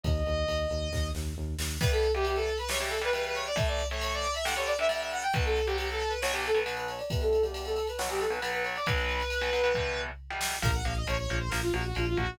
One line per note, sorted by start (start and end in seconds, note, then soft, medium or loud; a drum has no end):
0.03 0.23 D#2 loud
0.03 1.08 D#5 medium
0.03 kick loud
0.03 ride medium
0.26 0.45 D#2 medium
0.26 ride medium
0.48 0.66 D#2 medium
0.48 ride medium
0.70 0.89 D#2 medium
0.70 ride medium
0.92 1.11 D#2 medium
0.92 kick medium
0.92 snare medium
1.15 1.34 D#2 medium
1.15 snare medium
1.37 1.56 D#2 medium
1.59 1.77 D#2 medium
1.59 snare loud
1.81 2.07 E3 medium
1.81 2.07 G3 loud
1.81 2.07 B3 loud
1.81 1.92 B4 loud
1.81 kick loud
1.81 crash loud
1.91 2.11 A4 loud
1.91 ride medium
2.03 ride medium
2.14 2.50 E3 medium
2.14 2.50 G3 medium
2.14 2.50 B3 medium
2.14 2.25 G4 loud
2.14 ride medium
2.25 2.36 G4 loud
2.25 ride loud
2.35 2.56 A4 loud
2.35 ride medium
2.47 ride medium
2.58 2.69 B4 loud
2.58 ride medium
2.69 2.78 C#3 medium
2.69 2.78 E3 medium
2.69 2.78 G3 loud
2.69 2.79 C#5 loud
2.69 snare loud
2.80 2.98 C#3 medium
2.80 2.98 E3 medium
2.80 2.98 G3 medium
2.80 2.90 G4 medium
2.80 ride medium
2.89 3.00 A4 loud
2.89 ride medium
3.01 3.10 C#3 medium
3.01 3.10 E3 medium
3.01 3.10 G3 medium
3.01 3.13 B4 loud
3.01 ride medium
3.13 3.49 C#3 medium
3.13 3.49 E3 medium
3.13 3.49 G3 medium
3.13 3.24 B4 loud
3.13 ride loud
3.24 3.36 B4 loud
3.24 ride medium
3.35 3.45 C#5 loud
3.35 ride medium
3.46 3.57 D5 loud
3.46 ride medium
3.56 3.82 A2 loud
3.56 3.82 E3 medium
3.56 3.82 A3 loud
3.56 3.67 E5 loud
3.56 kick loud
3.56 ride loud
3.68 3.86 D5 medium
3.68 ride medium
3.79 ride medium
3.90 4.26 A2 medium
3.90 4.26 E3 medium
3.90 4.26 A3 medium
3.90 4.01 C#5 medium
3.90 ride medium
4.01 4.12 C#5 loud
4.01 ride loud
4.12 4.34 D5 loud
4.12 ride medium
4.24 ride medium
4.34 4.45 E5 loud
4.34 ride medium
4.44 4.54 G2 loud
4.44 4.54 D3 loud
4.44 4.54 G3 medium
4.44 4.55 F#5 medium
4.44 snare loud
4.56 4.74 G2 medium
4.56 4.74 D3 medium
4.56 4.74 G3 medium
4.56 4.66 C#5 medium
4.56 ride medium
4.66 4.77 D5 medium
4.66 ride medium
4.78 4.88 G2 medium
4.78 4.88 D3 medium
4.78 4.88 G3 medium
4.78 4.90 E5 loud
4.78 ride medium
4.89 5.24 G2 medium
4.89 5.24 D3 medium
4.89 5.24 G3 medium
4.89 5.00 E5 loud
4.89 ride loud
5.01 5.11 E5 medium
5.01 ride medium
5.11 5.23 F#5 medium
5.11 ride medium
5.22 5.33 G5 loud
5.22 ride medium
5.33 5.60 B1 medium
5.33 5.60 B2 loud
5.33 5.60 F#3 medium
5.33 5.44 B4 loud
5.33 kick loud
5.33 ride loud
5.44 5.66 A4 medium
5.44 ride medium
5.56 ride medium
5.66 6.03 B1 medium
5.66 6.03 B2 medium
5.66 6.03 F#3 medium
5.66 5.76 G4 loud
5.66 ride medium
5.77 5.87 G4 medium
5.77 ride loud
5.89 6.12 A4 loud
5.89 ride medium
6.00 ride medium
6.09 6.19 B4 medium
6.09 ride medium
6.21 6.32 B1 medium
6.21 6.32 B2 medium
6.21 6.32 F#3 medium
6.21 6.32 C#5 loud
6.21 snare loud
6.32 6.50 B1 medium
6.32 6.50 B2 medium
6.32 6.50 F#3 medium
6.32 6.43 G4 loud
6.32 ride medium
6.44 6.57 A4 loud
6.44 ride medium
6.55 6.63 B1 medium
6.55 6.63 B2 medium
6.55 6.63 F#3 medium
6.55 6.64 B4 medium
6.55 ride medium
6.64 7.01 B1 medium
6.64 7.01 B2 medium
6.64 7.01 F#3 medium
6.64 6.75 B4 loud
6.64 ride loud
6.77 6.87 B4 medium
6.77 ride medium
6.88 7.00 C#5 loud
6.88 ride medium
6.99 7.09 D5 medium
6.99 ride medium
7.10 7.37 E2 medium
7.10 7.37 B2 medium
7.10 7.37 G3 medium
7.10 7.21 B4 loud
7.10 kick loud
7.10 ride loud
7.21 7.42 A4 loud
7.21 ride medium
7.33 ride medium
7.43 7.78 E2 medium
7.43 7.78 B2 medium
7.43 7.78 G3 medium
7.43 7.53 G4 loud
7.43 ride medium
7.54 7.64 G4 loud
7.54 ride loud
7.65 7.86 A4 loud
7.65 ride medium
7.76 ride medium
7.87 7.99 B4 loud
7.87 ride medium
7.98 8.08 B1 medium
7.98 8.08 B2 loud
7.98 8.08 F#3 medium
7.98 8.08 C#5 loud
7.98 snare loud
8.09 8.27 B1 medium
8.09 8.27 B2 medium
8.09 8.27 F#3 medium
8.09 8.21 G4 loud
8.09 ride medium
8.19 8.30 A4 loud
8.19 ride medium
8.30 8.39 B1 medium
8.30 8.39 B2 medium
8.30 8.39 F#3 medium
8.30 8.40 B4 medium
8.30 ride medium
8.40 8.77 B1 medium
8.40 8.77 B2 medium
8.40 8.77 F#3 medium
8.40 8.51 B4 loud
8.40 ride loud
8.53 8.63 B4 loud
8.53 ride medium
8.63 8.74 C#5 medium
8.63 ride medium
8.76 8.86 D5 medium
8.76 ride medium
8.86 9.22 B1 loud
8.86 9.22 B2 medium
8.86 9.22 F#3 medium
8.86 10.01 B4 loud
8.86 kick loud
8.86 ride loud
8.98 ride medium
9.09 ride medium
9.20 ride medium
9.30 ride loud
9.41 9.50 B1 medium
9.41 9.50 B2 medium
9.41 9.50 F#3 medium
9.41 ride medium
9.53 9.61 B1 medium
9.53 9.61 B2 medium
9.53 9.61 F#3 medium
9.53 ride medium
9.64 9.72 B1 medium
9.64 9.72 B2 medium
9.64 9.72 F#3 medium
9.64 ride medium
9.74 10.10 E2 medium
9.74 10.10 B2 medium
9.74 10.10 G3 medium
9.74 kick medium
9.74 floor tom medium
10.30 10.57 E2 medium
10.30 10.57 B2 medium
10.30 10.57 G3 medium
10.41 snare loud
10.62 10.81 A#1 medium
10.62 10.71 F3 loud
10.62 10.71 A#3 loud
10.62 10.74 A#4 loud
10.62 kick loud
10.62 crash loud
10.74 10.85 F#5 medium
10.85 11.04 A#1 medium
10.85 10.94 F3 medium
10.85 10.94 A#3 medium
10.85 10.95 F5 medium
10.85 ride medium
10.96 11.07 D#5 medium
11.07 11.26 A#1 medium
11.07 11.16 F3 medium
11.07 11.16 A#3 medium
11.07 11.17 C#5 medium
11.07 ride loud
11.17 11.37 C#5 medium
11.29 11.49 A#1 medium
11.29 11.39 F3 medium
11.29 11.39 A#3 medium
11.29 ride medium
11.39 11.50 C5 medium
11.49 11.70 A#1 medium
11.49 11.61 F3 medium
11.49 11.61 A#3 medium
11.49 11.60 A#4 medium
11.49 snare loud
11.62 11.72 F4 medium
11.73 11.92 A#1 medium
11.73 11.83 F3 medium
11.73 11.83 A#3 medium
11.73 11.84 F#4 loud
11.73 ride medium
11.86 11.97 F#4 medium
11.95 12.15 A#1 medium
11.95 12.05 F3 medium
11.95 12.05 A#3 medium
11.95 12.07 F4 medium
11.95 ride medium
12.07 12.18 F4 loud
12.16 12.37 A#1 medium
12.16 12.26 F3 medium
12.16 12.26 A#3 medium
12.16 12.36 F#4 medium
12.16 kick medium
12.16 ride medium